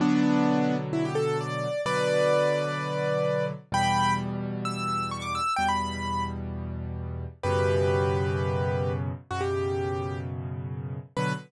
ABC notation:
X:1
M:4/4
L:1/16
Q:1/4=129
K:Bm
V:1 name="Acoustic Grand Piano"
[B,D]8 E G A2 d4 | [Bd]16 | [gb]4 z4 e'4 c' d' e'2 | g b5 z10 |
[GB]16 | F G7 z8 | B4 z12 |]
V:2 name="Acoustic Grand Piano" clef=bass
[B,,D,F,]16 | [B,,D,F,]16 | [E,,B,,G,]16 | [E,,B,,G,]16 |
[F,,B,,C,]16 | [F,,B,,C,]16 | [B,,D,F,]4 z12 |]